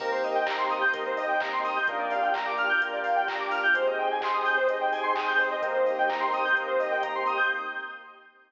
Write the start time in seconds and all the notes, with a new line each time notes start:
0.00 C2 A#3 C4 D#4 G4 A#4, kick, crash
0.12 C5
0.23 D#5, open hi-hat
0.35 G5
0.46 A#5, kick, clap
0.58 C6
0.70 D#6, open hi-hat
0.81 G6
0.93 C2 A#3 C4 D#4 G4 A#4, kick, closed hi-hat
1.06 C5
1.17 D#5, open hi-hat
1.28 G5
1.40 A#5, kick, clap
1.53 C6
1.64 D#6, open hi-hat
1.76 G6
1.87 A#1 A#3 D4 F4 G4 A#4, kick, closed hi-hat
1.99 D5
2.10 F5, open hi-hat
2.22 G5
2.34 A#5, kick, clap
2.46 D6
2.58 F6, open hi-hat
2.69 G6
2.81 A#1 A#3 D4 F4 G4 A#4, kick, closed hi-hat
2.93 D5
3.04 F5, open hi-hat
3.16 G5
3.28 A#5, kick, clap
3.40 D6
3.51 F6, open hi-hat
3.63 G6
3.74 G#1 C4 D#4 G4 G#4 C5, kick, closed hi-hat
3.87 D#5
3.98 G5
4.11 G#5
4.21 C6, kick, clap
4.34 D#6
4.45 G6, open hi-hat
4.57 C5
4.68 G#1 C4 D#4 G4 G#4 D#5, kick, closed hi-hat
4.81 G5
4.92 G#5, open hi-hat
5.03 C6
5.15 D#6, kick, clap
5.28 G6
5.38 C5, open hi-hat
5.51 D#5
5.62 C2 A#3 C4 D#4 G4 A#4, kick, closed hi-hat
5.74 C5
5.86 D#5, open hi-hat
5.98 G5
6.09 A#5, kick, clap
6.20 C6
6.33 D#6, open hi-hat
6.45 G6
6.55 C2 A#3 C4 D#4 G4 A#4, kick, closed hi-hat
6.67 C5
6.79 D#5, open hi-hat
6.91 G5
7.03 A#5, kick, closed hi-hat
7.15 C6
7.26 D#6, open hi-hat
7.37 G6